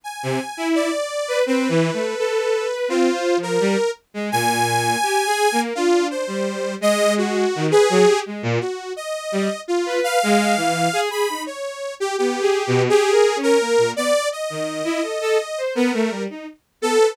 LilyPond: <<
  \new Staff \with { instrumentName = "Lead 2 (sawtooth)" } { \time 6/4 \tempo 4 = 84 aes''4 d''4 b'2 f'8. bes'8. r8 | aes''2 f'8 c''4 ees''8 ges'8. aes'8. r8 | ges'8 ees''4 f'8 f''4. b''8 des''8. g'16 g'4 | aes'8. bes'8. d''8 ees''2 bes'8. r8. a'8 | }
  \new Staff \with { instrumentName = "Violin" } { \time 6/4 r16 c16 r16 e'8 r8 b'16 \tuplet 3/2 { c'8 e8 a8 } a'8. b'16 \tuplet 3/2 { c'8 c''8 f8 } g16 r8 aes16 | bes,4 \tuplet 3/2 { g'8 aes'8 bes8 } d'8. g8. aes4 ees16 b'16 ges16 g'16 aes16 bes,16 | r4 g16 r8 b'8 aes8 e8 aes'16 aes'16 ees'16 r4 \tuplet 3/2 { b8 aes'8 b,8 } | \tuplet 3/2 { g'8 bes'8 des'8 } bes16 bes,16 b16 r8 ees8 e'16 a'16 a'16 r16 c''16 b16 a16 g16 ees'16 r8 b16 b'16 | }
>>